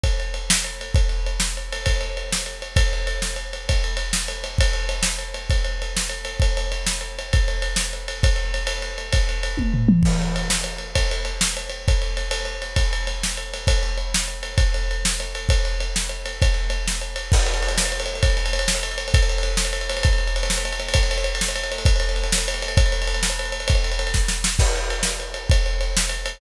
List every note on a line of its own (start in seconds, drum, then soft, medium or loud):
0.04 kick medium
0.04 ride medium
0.20 ride medium
0.34 ride medium
0.50 snare loud
0.64 ride medium
0.81 ride medium
0.95 kick loud
0.95 ride medium
1.09 ride medium
1.26 ride medium
1.40 snare loud
1.57 ride medium
1.72 ride medium
1.86 kick medium
1.86 ride loud
2.01 ride medium
2.17 ride medium
2.32 snare loud
2.46 ride medium
2.62 ride medium
2.76 kick loud
2.76 ride loud
2.93 ride medium
3.07 ride medium
3.22 snare medium
3.36 ride medium
3.53 ride medium
3.69 kick medium
3.69 ride loud
3.84 ride medium
3.97 ride medium
4.13 snare loud
4.28 ride medium
4.44 ride medium
4.58 kick loud
4.58 ride loud
4.73 ride medium
4.89 ride medium
5.03 snare loud
5.19 ride medium
5.34 ride medium
5.50 kick medium
5.50 ride medium
5.64 ride medium
5.82 ride medium
5.97 snare loud
6.09 ride medium
6.25 ride medium
6.40 kick loud
6.40 ride medium
6.57 ride medium
6.72 ride medium
6.87 snare loud
7.01 ride medium
7.19 ride medium
7.33 kick loud
7.33 ride medium
7.48 ride medium
7.62 ride medium
7.76 snare loud
7.93 ride medium
8.08 ride medium
8.23 kick loud
8.23 ride loud
8.36 ride medium
8.54 ride medium
8.67 ride loud
8.82 ride medium
8.98 ride medium
9.12 kick loud
9.12 ride loud
9.29 ride medium
9.43 ride medium
9.57 kick medium
9.57 high tom medium
9.74 floor tom medium
9.89 mid tom loud
10.03 kick loud
10.03 crash loud
10.22 ride medium
10.36 ride medium
10.50 snare loud
10.64 ride medium
10.78 ride medium
10.95 kick medium
10.95 ride loud
11.11 ride medium
11.25 ride medium
11.41 snare loud
11.57 ride medium
11.70 ride medium
11.88 kick loud
11.88 ride medium
12.02 ride medium
12.17 ride medium
12.31 ride loud
12.45 ride medium
12.62 ride medium
12.76 kick medium
12.76 ride loud
12.93 ride medium
13.07 ride medium
13.23 snare loud
13.37 ride medium
13.54 ride medium
13.67 kick loud
13.67 ride loud
13.83 ride medium
13.98 ride medium
14.14 snare loud
14.28 ride medium
14.43 ride medium
14.58 kick loud
14.58 ride loud
14.74 ride medium
14.91 ride medium
15.05 snare loud
15.20 ride medium
15.35 ride medium
15.49 kick loud
15.49 ride loud
15.65 ride medium
15.80 ride medium
15.96 snare loud
16.09 ride medium
16.26 ride medium
16.42 kick loud
16.42 ride loud
16.54 ride medium
16.70 ride medium
16.88 snare medium
17.01 ride medium
17.16 ride medium
17.32 kick loud
17.32 crash loud
17.39 ride medium
17.46 ride medium
17.54 ride medium
17.62 ride medium
17.68 ride medium
17.78 snare loud
17.85 ride medium
17.92 ride medium
18.00 ride medium
18.06 ride medium
18.15 ride medium
18.23 kick loud
18.23 ride loud
18.30 ride medium
18.37 ride medium
18.46 ride medium
18.53 ride medium
18.59 ride medium
18.68 snare loud
18.75 ride medium
18.83 ride medium
18.91 ride medium
18.98 ride medium
19.08 ride medium
19.14 kick loud
19.14 ride loud
19.22 ride medium
19.29 ride medium
19.38 ride medium
19.43 ride medium
19.57 snare loud
19.65 ride medium
19.73 ride medium
19.81 ride medium
19.89 ride medium
19.97 ride medium
20.03 kick loud
20.03 ride loud
20.13 ride medium
20.18 ride medium
20.27 ride medium
20.36 ride medium
20.43 ride medium
20.50 snare loud
20.58 ride medium
20.65 ride medium
20.72 ride medium
20.80 ride medium
20.88 ride medium
20.94 kick loud
20.94 ride loud
21.03 ride medium
21.11 ride medium
21.18 ride medium
21.24 ride medium
21.35 ride medium
21.41 snare loud
21.48 ride medium
21.56 ride medium
21.64 ride medium
21.72 ride medium
21.78 ride medium
21.85 kick loud
21.85 ride loud
21.96 ride medium
22.00 ride medium
22.09 ride medium
22.16 ride medium
22.23 ride medium
22.32 snare loud
22.38 ride medium
22.48 ride medium
22.54 ride medium
22.62 ride medium
22.68 ride medium
22.77 kick loud
22.77 ride loud
22.86 ride medium
22.92 ride medium
23.02 ride medium
23.07 ride medium
23.14 ride medium
23.23 snare loud
23.30 ride medium
23.39 ride medium
23.45 ride medium
23.52 ride medium
23.60 ride medium
23.68 kick loud
23.68 ride loud
23.75 ride medium
23.84 ride medium
23.92 ride medium
23.99 ride medium
24.07 ride medium
24.14 kick medium
24.14 snare medium
24.28 snare medium
24.44 snare loud
24.59 kick loud
24.59 crash loud
24.76 ride medium
24.90 ride medium
25.03 snare loud
25.20 ride medium
25.34 ride medium
25.50 kick loud
25.50 ride loud
25.66 ride medium
25.81 ride medium
25.97 snare loud
26.09 ride medium
26.26 ride medium